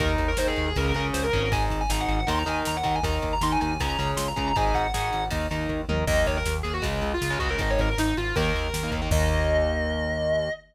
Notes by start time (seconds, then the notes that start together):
0.00 D#2 D#4 A#4, kick, ride
0.18 D#2, kick, ride
0.28 A#4
0.37 D#2 D#4 A#4 C5, snare
0.47 G#4
0.56 D#2 G#4, ride
0.67 G#4
0.76 C#2 C#4 G#4 A#4, kick, ride
0.86 A#4
0.94 C#2 C#4 G#4 A#4, ride
1.14 C#2 C5, snare
1.23 A#4
1.33 G#1 C#4 G#4 A#4, kick, ride
1.43 A#4
1.52 D#4 G#4 G#5, kick, ride
1.70 G#1, kick, ride
1.81 G#5
1.89 G#1 D#4 G#4 A#5, snare
2.00 F#5
2.08 G#1 F#5, ride
2.20 F#5
2.27 D#2 D#4 A#4 C6, kick, ride
2.39 A#5
2.46 D#2 D#4 A#4 G#5, ride
2.65 D#2 A#5, snare
2.76 F#5
2.83 D#2 D#4 A#4 F#5, kick, ride
2.95 G#5
3.03 D#2 D#4 A#4 A#5, kick, ride
3.22 D#2, kick, ride
3.33 A#5
3.41 D#2 D#4 A#4 C6, snare
3.52 G#5
3.61 D#2 G#5, ride
3.71 G#5
3.80 C#2 C#4 G#4 A#5, kick, ride
3.89 A#5
3.98 C#2 C#4 G#4 A#5, ride
4.17 C#2 C6, snare
4.28 A#5
4.36 C#2 C#4 G#4 A#5, kick, ride
4.48 A#5
4.56 G#1 D#4 G#4 G#5, kick, ride
4.74 G#1 F#5, kick, ride
4.94 G#1 D#4 G#4, snare
5.13 G#1, ride
5.31 D#2 D#4 A#4, kick, ride
5.51 D#2 D#4 A#4, ride
5.69 D#2, kick
5.89 D#2 D#4 A#4, mid tom
6.07 D#2 D#3 A#3 D#5, kick, crash
6.27 D#2 C#5, kick, ride
6.37 A#4
6.45 D#2, snare
6.63 D#2 G#4, ride
6.73 F#4
6.82 C#2 C#3 G#3, kick, ride
7.01 C#2, ride
7.14 F4
7.21 C#2, snare
7.30 C#3 G#3
7.39 C#2 C#3 G#3 F#4, kick, ride
7.49 C#3 G#3 A#4
7.58 G#1 D#3 G#3 D#5, kick, ride
7.70 C#5
7.79 G#1 A#4, kick, ride
7.89 A#4
7.97 G#1 D#4, snare
8.17 G#1 F4, ride
8.36 D#2 D#3 A#3 A#4, kick, ride
8.55 D#2, ride
8.73 D#2, snare
8.83 D#3 A#3
8.91 D#2 D#3 A#3, kick, ride
9.02 D#3 A#3
9.11 D#2 D#3 A#3 D#5, kick, crash